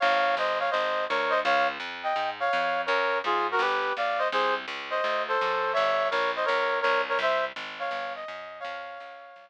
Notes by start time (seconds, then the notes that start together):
0.00 G#1 C#5 F5
0.37 G1 C5 D#5
0.59 C#5 F5
0.70 G#1 C5 D#5
1.09 D2 A#4 C#5
1.29 C5 D#5
1.44 C#2 C#5 F5
1.80 F2
2.03 D#5 G5
2.16 G#2
2.40 C#5 F5
2.53 F2
2.86 F#2 A#4 C#5
3.24 G#2 F4 G#4
3.51 F#4 A#4
3.59 G1 G4 B4
3.97 B1 D5 F5
4.18 C5 D#5
4.32 C2 G#4 C5
4.68 C#2
4.90 C5 D#5
5.04 D2
5.28 A4 C5
5.41 F#2
5.73 G1 C#5 E5
6.10 A#1 A#4 C#5
6.36 C5 D#5
6.45 C#2 A#4 C#5
6.81 C2 A#4 C#5
7.09 A#4 C#5
7.19 C2 C5 E5
7.56 G#1
7.79 C#5 F5
7.91 G1
8.15 D#5
8.28 F#2
8.60 C#5 F5
8.65 F2
9.00 C#2
9.36 C2